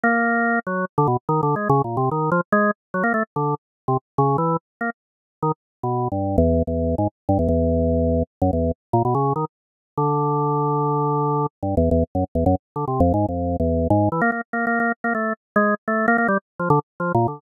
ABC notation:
X:1
M:6/4
L:1/16
Q:1/4=145
K:none
V:1 name="Drawbar Organ"
_B,6 _G,2 z D, =B,, z (3_E,2 D,2 _A,2 (3_D,2 _B,,2 C,2 E,2 F, z | _A,2 z2 _G, _B, =A, z D,2 z3 C, z2 _D,2 E,2 z2 B, z | z4 _E, z3 (3B,,4 G,,4 =E,,4 E,,3 _A,, z2 G,, E,, | E,,8 z _G,, E,,2 z2 _B,, =B,, _D,2 _E, z5 |
D,16 (3G,,2 E,,2 E,,2 z _G,, z E,, | _G,, z2 D, (3C,2 F,,2 _A,,2 F,,3 E,,3 A,,2 E, _B, B, z (3B,2 B,2 B,2 | z _B, A,2 z2 _A,2 z =A,2 B, B, G, z2 F, D, z2 (3F,2 _B,,2 D,2 |]